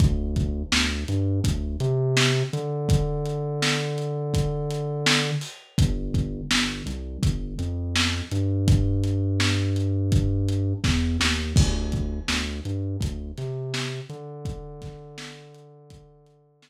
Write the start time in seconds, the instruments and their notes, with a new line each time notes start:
0.00 synth bass 2 D2, kick, closed hi-hat
0.36 kick, closed hi-hat
0.72 synth bass 2 D2, snare
1.08 synth bass 2 G2, closed hi-hat
1.44 synth bass 2 D2, kick, closed hi-hat
1.80 synth bass 2 C3, closed hi-hat
2.17 snare
2.53 synth bass 2 D3, closed hi-hat
2.89 kick, closed hi-hat
3.25 closed hi-hat
3.62 snare
3.98 closed hi-hat
4.34 kick, closed hi-hat
4.70 closed hi-hat
5.06 snare
5.41 open hi-hat
5.78 synth bass 2 G1, kick, closed hi-hat
6.14 kick, closed hi-hat
6.51 synth bass 2 G1, snare
6.86 synth bass 2 C2, closed hi-hat
7.23 synth bass 2 G1, kick, closed hi-hat
7.59 synth bass 2 F2, closed hi-hat
7.95 snare
8.31 synth bass 2 G2, closed hi-hat
8.68 kick, closed hi-hat
9.04 closed hi-hat
9.40 snare
9.76 closed hi-hat
10.12 kick, closed hi-hat
10.48 closed hi-hat
10.84 synth bass 2 E2, kick, snare
11.20 synth bass 2 D#2, snare
11.56 synth bass 2 D2, kick, crash
11.92 kick, closed hi-hat
12.28 synth bass 2 D2, snare
12.65 synth bass 2 G2, closed hi-hat
13.00 synth bass 2 D2, kick, closed hi-hat
13.38 synth bass 2 C3, snare, closed hi-hat
13.74 snare
14.09 synth bass 2 D3, closed hi-hat
14.45 kick, closed hi-hat
14.82 kick, snare, closed hi-hat
15.18 snare
15.55 closed hi-hat
15.90 kick, closed hi-hat
16.26 closed hi-hat
16.62 snare